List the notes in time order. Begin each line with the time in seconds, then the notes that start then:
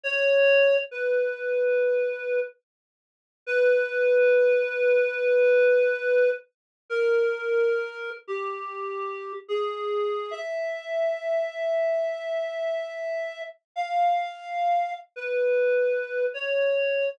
0.04 C#5
0.91 B4
3.47 B4
6.90 A#4
8.28 G4
9.48 G#4
10.31 E5
13.76 F5
15.16 B4
16.34 C#5